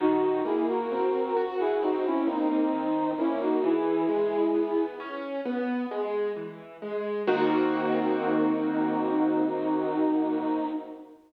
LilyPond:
<<
  \new Staff \with { instrumentName = "Brass Section" } { \time 4/4 \key dis \phrygian \tempo 4 = 66 <dis' fis'>8 <e' gis'>16 <fis' ais'>4 <e' gis'>16 <dis' fis'>16 <cis' e'>16 <bis dis'>16 <bis dis'>8. <cis' e'>16 <dis' fis'>16 | <e' gis'>4. r2 r8 | dis'1 | }
  \new Staff \with { instrumentName = "Acoustic Grand Piano" } { \time 4/4 \key dis \phrygian dis8 ais8 bis8 fis'8 bis8 ais8 dis8 ais8 | e8 gis8 b8 cis'8 b8 gis8 e8 gis8 | <dis ais bis fis'>1 | }
>>